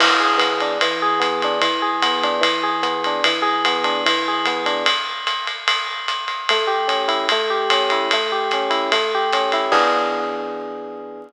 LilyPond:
<<
  \new Staff \with { instrumentName = "Electric Piano 1" } { \time 4/4 \key e \major \tempo 4 = 148 e8 gis'8 b8 d'8 e8 gis'8 b8 d'8 | e8 gis'8 b8 d'8 e8 gis'8 b8 d'8 | e8 gis'8 b8 d'8 e8 gis'8 b8 d'8 | r1 |
a8 g'8 cis'8 e'8 a8 g'8 cis'8 e'8 | a8 g'8 cis'8 e'8 a8 g'8 cis'8 e'8 | <e b d' gis'>1 | }
  \new DrumStaff \with { instrumentName = "Drums" } \drummode { \time 4/4 <cymc cymr>4 <hhp bd cymr>8 cymr8 cymr4 <hhp bd cymr>8 cymr8 | cymr4 <hhp bd cymr>8 cymr8 <bd cymr>4 <hhp cymr>8 cymr8 | cymr4 <hhp cymr>8 cymr8 cymr4 <hhp bd cymr>8 cymr8 | <bd cymr>4 <hhp cymr>8 cymr8 cymr4 <hhp cymr>8 cymr8 |
cymr4 <hhp cymr>8 cymr8 <bd cymr>4 <hhp bd cymr>8 cymr8 | cymr4 <hhp cymr>8 cymr8 cymr4 <hhp cymr>8 cymr8 | <cymc bd>4 r4 r4 r4 | }
>>